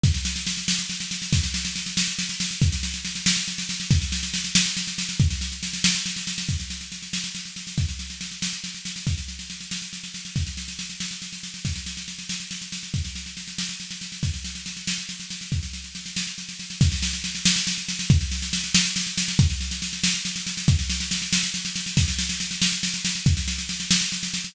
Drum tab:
SD |oooooooooooo|oooooooooooo|oooooooooooo|oooooooooooo|
BD |o-----------|o-----------|o-----------|o-----------|

SD |oooooooooooo|oooooooooooo|oooooooooooo|oooooooooooo|
BD |o-----------|o-----------|o-----------|o-----------|

SD |oooooooooooo|oooooooooooo|oooooooooooo|oooooooooooo|
BD |o-----------|o-----------|o-----------|o-----------|

SD |oooooooooooo|oooooooooooo|oooooooooooo|oooooooooooo|
BD |o-----------|o-----------|o-----------|o-----------|

SD |oooooooooooo|oooooooooooo|oooooooooooo|
BD |o-----------|o-----------|o-----------|